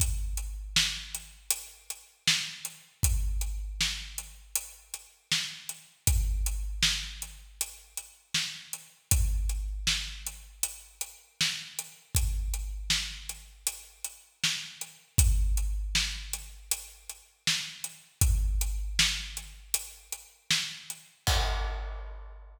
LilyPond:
\new DrumStaff \drummode { \time 12/8 \tempo 4. = 79 <hh bd>8. hh8. sn8. hh8. hh8. hh8. sn8. hh8. | <hh bd>8. hh8. sn8. hh8. hh8. hh8. sn8. hh8. | <hh bd>8. hh8. sn8. hh8. hh8. hh8. sn8. hh8. | <hh bd>8. hh8. sn8. hh8. hh8. hh8. sn8. hh8. |
<hh bd>8. hh8. sn8. hh8. hh8. hh8. sn8. hh8. | <hh bd>8. hh8. sn8. hh8. hh8. hh8. sn8. hh8. | <hh bd>8. hh8. sn8. hh8. hh8. hh8. sn8. hh8. | <cymc bd>4. r4. r4. r4. | }